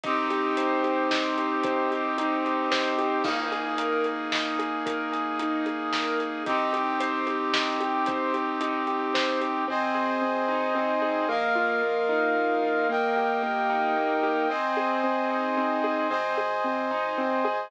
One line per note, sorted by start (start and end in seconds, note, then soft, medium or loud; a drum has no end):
0.03 1.51 C2 medium
0.03 3.23 C4 medium
0.03 1.10 D#4 medium
0.03 3.23 D#4 medium
0.03 3.23 G4 medium
0.03 kick medium
0.03 closed hi-hat medium
0.30 0.83 G4 medium
0.30 closed hi-hat medium
0.57 1.64 C5 medium
0.57 closed hi-hat medium
0.84 1.37 G4 medium
0.84 closed hi-hat medium
1.11 2.17 D#4 medium
1.11 snare loud
1.37 1.91 G4 medium
1.37 closed hi-hat medium
1.63 2.66 C2 medium
1.63 2.71 C5 medium
1.63 kick medium
1.63 closed hi-hat medium
1.91 2.44 G4 medium
1.91 closed hi-hat medium
2.18 3.20 D#4 medium
2.18 closed hi-hat medium
2.45 2.98 G4 medium
2.45 closed hi-hat medium
2.71 2.95 A#1 medium
2.71 3.22 C5 medium
2.71 snare medium
2.98 3.22 A1 medium
2.98 3.24 G4 medium
2.98 closed hi-hat medium
3.24 4.73 G#1 medium
3.24 6.43 A#3 medium
3.24 6.43 D#4 medium
3.24 3.52 D#4 medium
3.24 6.43 G#4 medium
3.24 kick medium
3.24 crash medium
3.52 3.79 G#4 medium
3.52 closed hi-hat medium
3.78 4.05 A#4 medium
3.78 closed hi-hat medium
4.04 4.32 G#4 soft
4.04 closed hi-hat medium
4.32 4.59 D#4 medium
4.32 snare medium
4.59 4.86 G#4 medium
4.59 closed hi-hat medium
4.86 6.34 G#1 medium
4.86 5.12 A#4 medium
4.86 kick medium
4.86 closed hi-hat medium
5.12 5.39 G#4 medium
5.12 closed hi-hat medium
5.39 5.66 D#4 medium
5.39 closed hi-hat medium
5.66 5.93 G#4 soft
5.66 closed hi-hat medium
5.93 6.20 A#4 medium
5.93 snare medium
6.20 6.45 G#4 medium
6.20 closed hi-hat medium
6.46 7.94 C2 medium
6.46 9.64 C4 medium
6.46 9.64 D#4 medium
6.46 6.73 D#4 medium
6.46 9.64 G4 medium
6.46 kick medium
6.46 closed hi-hat medium
6.73 7.00 G4 medium
6.73 closed hi-hat medium
7.00 7.27 C5 medium
7.00 closed hi-hat medium
7.27 7.54 G4 medium
7.27 closed hi-hat medium
7.54 7.80 D#4 medium
7.54 snare loud
7.80 8.07 G4 medium
7.80 closed hi-hat medium
8.06 9.09 C2 medium
8.06 8.34 C5 medium
8.06 kick medium
8.06 closed hi-hat medium
8.34 8.61 G4 medium
8.34 closed hi-hat medium
8.61 8.87 D#4 medium
8.61 closed hi-hat medium
8.87 9.14 G4 medium
8.87 closed hi-hat medium
9.14 9.38 A#1 medium
9.14 9.41 C5 medium
9.14 snare medium
9.41 9.65 A1 medium
9.41 9.67 G4 medium
9.41 closed hi-hat medium
9.68 9.91 G#1 loud
9.68 10.21 C4 medium
9.68 11.28 C5 medium
9.68 11.28 D#5 medium
9.68 11.28 G#5 medium
9.95 10.17 G#1 loud
9.95 11.01 G#4 medium
10.21 10.44 G#1 medium
10.21 10.75 C4 medium
10.48 10.71 G#1 medium
10.48 11.25 D#4 medium
10.75 10.98 G#1 medium
10.75 11.26 C4 medium
11.02 11.24 G#1 medium
11.02 11.27 G#4 medium
11.29 11.51 A#1 loud
11.29 11.82 A#3 medium
11.29 12.88 A#4 medium
11.29 12.88 D#5 medium
11.29 12.88 F5 medium
11.55 11.78 A#1 medium
11.55 12.62 F4 medium
11.82 12.05 A#1 medium
11.82 12.35 A#3 medium
12.09 12.31 A#1 medium
12.09 12.85 D#4 medium
12.35 12.58 A#1 loud
12.35 12.87 A#3 medium
12.62 12.85 A#1 medium
12.62 12.88 F4 medium
12.89 13.12 G1 medium
12.89 13.42 A#3 medium
12.89 14.49 A#4 medium
12.89 14.48 D#5 medium
12.89 14.49 G5 medium
13.16 13.39 G1 medium
13.16 14.23 G4 medium
13.43 13.66 G1 medium
13.43 13.96 A#3 medium
13.70 13.92 G1 loud
13.70 14.46 D#4 medium
13.96 14.19 G1 medium
13.96 14.47 A#3 medium
14.23 14.46 G1 medium
14.23 14.49 G4 medium
14.49 15.03 C4 medium
14.49 16.08 C5 medium
14.49 16.08 D#5 medium
14.49 16.08 G#5 medium
14.77 15.83 G#4 medium
15.04 15.57 C4 medium
15.30 16.07 D#4 medium
15.57 16.08 C4 medium
15.84 16.09 G#4 medium
16.09 16.33 G#1 loud
16.09 16.37 C4 medium
16.09 17.68 C5 medium
16.09 17.68 D#5 medium
16.09 17.68 G#5 medium
16.37 16.60 G#1 loud
16.37 16.64 G#4 medium
16.64 16.87 G#1 medium
16.64 16.91 C4 medium
16.91 17.14 G#1 medium
16.91 17.18 D#4 medium
17.18 17.41 G#1 medium
17.18 17.45 C4 medium
17.45 17.67 G#1 medium
17.45 17.70 G#4 medium